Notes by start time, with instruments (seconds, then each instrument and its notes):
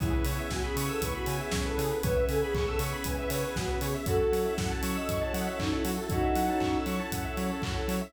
0.00 synth bass 1 C#2, drawbar organ B3 C#4 E4 G#4, string ensemble 1 B3 C#4 E4 G#4, ocarina E4, lead 1 (square) G#4, kick, closed hi-hat
0.13 lead 1 (square) B4
0.24 synth bass 1 C#3, lead 1 (square) C#5, open hi-hat
0.38 lead 1 (square) E5
0.50 synth bass 1 C#2, ocarina F#4, lead 1 (square) G#5, kick, snare
0.64 ocarina G#4, lead 1 (square) B5
0.76 synth bass 1 C#3, lead 1 (square) C#6, open hi-hat
0.89 ocarina A4, lead 1 (square) E6
1.02 synth bass 1 C#2, ocarina B4, lead 1 (square) C#6, kick, closed hi-hat
1.14 ocarina F#4, lead 1 (square) B5
1.26 synth bass 1 C#3, lead 1 (square) G#5, open hi-hat
1.40 ocarina G#4, lead 1 (square) E5
1.51 synth bass 1 C#2, lead 1 (square) C#5, kick, snare
1.65 ocarina A4, lead 1 (square) B4
1.78 synth bass 1 C#3, lead 1 (square) G#4, open hi-hat
1.91 lead 1 (square) B4
2.03 synth bass 1 C#2, string ensemble 1 B3 C#4 G#4 B4, drawbar organ B3 C#4 E4 G#4, ocarina B4, lead 1 (square) C#5, kick, closed hi-hat
2.16 lead 1 (square) E5
2.29 synth bass 1 C#3, ocarina A4, lead 1 (square) G#5, open hi-hat
2.41 ocarina G#4, lead 1 (square) B5
2.54 synth bass 1 C#2, ocarina G#4, lead 1 (square) C#6, kick, clap
2.67 ocarina A4, lead 1 (square) E6
2.79 synth bass 1 C#3, lead 1 (square) C#6, open hi-hat
2.93 lead 1 (square) B5
3.04 synth bass 1 C#2, ocarina B4, lead 1 (square) G#5, kick, closed hi-hat
3.17 ocarina B4, lead 1 (square) E5
3.30 synth bass 1 C#3, ocarina B4, lead 1 (square) C#5, open hi-hat
3.43 ocarina G#4, lead 1 (square) B4
3.56 synth bass 1 C#2, ocarina F#4, lead 1 (square) G#4, kick, snare
3.69 lead 1 (square) B4
3.81 synth bass 1 C#3, ocarina G#4, lead 1 (square) C#5, open hi-hat
3.94 lead 1 (square) E5
4.06 synth bass 1 F#2, string ensemble 1 C#4 E4 F#4 A4, drawbar organ C#4 E4 F#4 A4, lead 1 (square) F#4, ocarina F#4 A4, kick, closed hi-hat
4.20 lead 1 (square) A4
4.32 synth bass 1 F#3, lead 1 (square) C#5, open hi-hat
4.45 lead 1 (square) E5
4.58 synth bass 1 F#2, lead 1 (square) F#5, kick, snare
4.70 lead 1 (square) A5
4.83 synth bass 1 F#3, lead 1 (square) C#6, open hi-hat
4.96 ocarina D#5, lead 1 (square) E6
5.08 synth bass 1 F#2, lead 1 (square) C#6, kick, closed hi-hat
5.21 ocarina C#5, lead 1 (square) A5
5.34 synth bass 1 F#3, ocarina D#5, lead 1 (square) F#5, open hi-hat
5.46 ocarina C#5, lead 1 (square) E5
5.59 synth bass 1 F#2, ocarina D#4, lead 1 (square) C#5, kick, clap
5.72 ocarina E4, lead 1 (square) A4
5.85 synth bass 1 F#3, ocarina E4, lead 1 (square) F#4, open hi-hat
5.97 lead 1 (square) A4
6.09 synth bass 1 F#2, string ensemble 1 C#4 E4 A4 C#5, drawbar organ C#4 E4 F#4 A4, ocarina D#4 F#4, lead 1 (square) C#5, kick, closed hi-hat
6.23 lead 1 (square) E5
6.35 synth bass 1 F#3, lead 1 (square) F#5, open hi-hat
6.48 lead 1 (square) A5
6.60 synth bass 1 F#2, lead 1 (square) C#6, kick, clap
6.74 lead 1 (square) E6
6.86 synth bass 1 F#3, lead 1 (square) C#6, open hi-hat
6.99 lead 1 (square) A5
7.12 synth bass 1 F#2, lead 1 (square) F#5, kick, closed hi-hat
7.24 lead 1 (square) E5
7.37 synth bass 1 F#3, lead 1 (square) C#5, open hi-hat
7.50 lead 1 (square) A4
7.62 synth bass 1 F#2, lead 1 (square) F#4, kick, clap
7.76 lead 1 (square) A4
7.88 synth bass 1 F#3, lead 1 (square) C#5, open hi-hat
8.01 lead 1 (square) E5